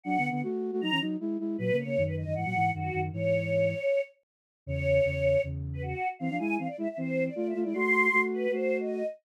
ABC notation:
X:1
M:4/4
L:1/16
Q:1/4=156
K:Alyd
V:1 name="Choir Aahs"
f3 f z4 ^a2 z6 | B2 c3 B d2 f4 F3 z | c10 z6 | c8 z3 B F3 z |
=f2 g2 f =d e e =c3 d (3d2 e2 d2 | ^b6 =B2 ^B3 d3 z2 |]
V:2 name="Flute"
(3[F,=D]2 [=D,B,]2 [D,B,]2 [A,F]3 [A,F] [F,^D] [E,C] [F,D]2 [G,E]2 [G,E]2 | (3[^A,,F,]2 [C,^A,]2 [C,A,]2 [F,,D,]3 [F,,D,] [G,,E,] [A,,F,] [G,,E,]2 [F,,D,]2 [F,,D,]2 | [G,,E,]8 z8 | [E,,C,]4 [E,,C,]4 [E,,C,]6 z2 |
[E,=C] [=F,=D] [G,E]2 [E,C] z [G,E] z [E,C]4 [A,=F]2 [A,F] [G,E] | [A,F]4 [A,F]4 [A,F]6 z2 |]